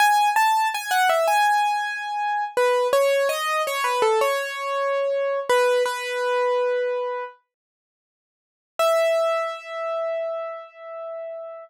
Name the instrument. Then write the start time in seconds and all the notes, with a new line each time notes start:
acoustic grand piano
0.00 G#5
0.36 A5
0.74 G#5
0.91 F#5
1.09 E5
1.28 G#5
2.57 B4
2.93 C#5
3.29 D#5
3.67 C#5
3.84 B4
4.02 A4
4.21 C#5
5.49 B4
5.86 B4
8.79 E5